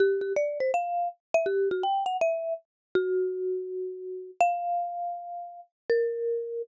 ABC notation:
X:1
M:4/4
L:1/8
Q:"Swing" 1/4=163
K:G
V:1 name="Marimba"
G G d c =f2 z e | G F g f e2 z2 | F8 | =f8 |
_B4 z4 |]